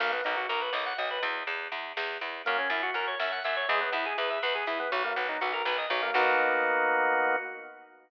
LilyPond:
<<
  \new Staff \with { instrumentName = "Drawbar Organ" } { \time 5/8 \key b \major \tempo 4 = 122 ais16 b16 dis'16 fis'16 ais'16 b'16 dis''16 fis''16 dis''16 b'16 | r2 r8 | ais16 cis'16 e'16 fis'16 ais'16 cis''16 e''16 fis''16 e''16 cis''16 | gis16 b16 e'16 gis'16 b'16 e''16 b'16 gis'16 e'16 b16 |
fis16 ais16 b16 dis'16 fis'16 ais'16 b'16 dis''16 fis16 ais16 | <ais b dis' fis'>2~ <ais b dis' fis'>8 | }
  \new Staff \with { instrumentName = "Electric Bass (finger)" } { \clef bass \time 5/8 \key b \major b,,8 b,,8 b,,8 b,,8 b,,8 | e,8 e,8 e,8 e,8 e,8 | fis,8 fis,8 fis,8 fis,8 fis,8 | e,8 e,8 e,8 e,8 e,8 |
b,,8 b,,8 b,,8 b,,8 b,,8 | b,,2~ b,,8 | }
  \new DrumStaff \with { instrumentName = "Drums" } \drummode { \time 5/8 <cymc bd>8 hh8 hh8 sn8 hh8 | <hh bd>8 hh8 hh8 sn8 hh8 | <hh bd>8 hh8 hh8 sn8 hh8 | <hh bd>8 hh8 hh8 sn8 hho8 |
<hh bd>4 hh8 sn8 hh8 | <cymc bd>4. r4 | }
>>